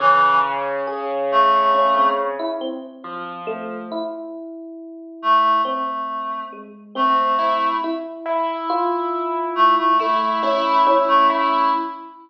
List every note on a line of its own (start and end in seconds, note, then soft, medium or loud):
0.00 2.35 C#3 loud
0.00 0.39 E3 loud
0.00 0.78 C#4 medium
0.87 1.46 G#4 medium
1.31 2.10 A3 loud
1.74 1.94 C#4 medium
1.96 2.16 C4 medium
2.39 2.59 E4 loud
2.61 3.39 C4 loud
3.04 3.82 F3 medium
3.47 3.86 A3 loud
3.92 5.48 E4 medium
5.22 5.61 A3 medium
5.65 6.44 A3 medium
5.65 6.43 C4 medium
6.53 6.92 G#3 medium
6.95 7.74 A3 medium
6.95 7.74 C4 medium
6.95 7.35 C4 soft
7.39 7.78 E4 medium
7.84 8.62 E4 medium
8.26 9.82 E4 medium
8.70 9.87 F4 loud
9.55 9.75 A3 loud
9.78 9.98 A3 medium
9.99 10.40 A3 medium
9.99 10.99 A3 medium
9.99 10.39 E4 medium
10.43 10.83 C#4 medium
10.43 10.82 E4 loud
10.87 11.65 C#4 loud
10.87 11.26 E4 medium
11.08 11.28 A3 loud
11.30 11.70 A3 medium
11.30 11.69 E4 loud